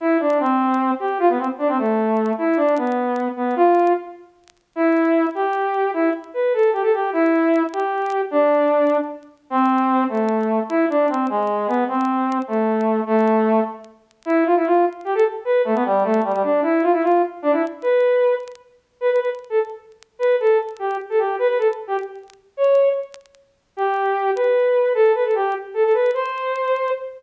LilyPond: \new Staff { \time 6/8 \key c \major \tempo 4. = 101 e'8 d'8 c'4. g'8 | f'16 b16 c'16 r16 d'16 c'16 a4. | e'8 d'8 b4. b8 | f'4 r2 |
e'4. g'4. | e'8 r8 b'8 a'8 g'16 a'16 g'8 | e'4. g'4. | d'2 r4 |
\key a \minor c'4. a4. | e'8 d'8 c'8 gis4 b8 | c'4. a4. | a4. r4. |
\key c \major e'8 f'16 e'16 f'8 r8 g'16 a'16 r8 | b'8 a16 b16 g8 a8 g16 g16 d'8 | e'8 f'16 e'16 f'8 r8 d'16 e'16 r8 | b'4. r4. |
\key g \major b'16 b'16 b'16 r8 a'16 r4. | b'8 a'8 r8 g'8 r16 a'16 g'8 | b'16 b'16 a'16 r8 g'16 r4. | cis''4 r2 |
\key c \major g'4. b'4. | a'8 b'16 a'16 g'8 r8 a'16 a'16 b'8 | c''2 r4 | }